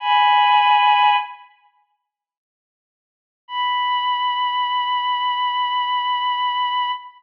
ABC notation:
X:1
M:4/4
L:1/8
Q:1/4=69
K:B
V:1 name="Violin"
[gb]3 z5 | b8 |]